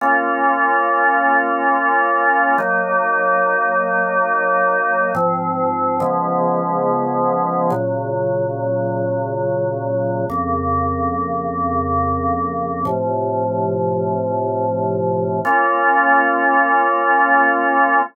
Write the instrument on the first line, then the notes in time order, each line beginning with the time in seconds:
drawbar organ
0.01 A#3 C#4 F4
2.58 F#3 A#3 D#4
5.15 G#2 F3 C4
6.00 C#3 F3 G#3 B3
7.70 A#2 C#3 F#3
10.30 F2 C#3 A#3
12.85 A2 C3 F3
15.45 A#3 C#4 F4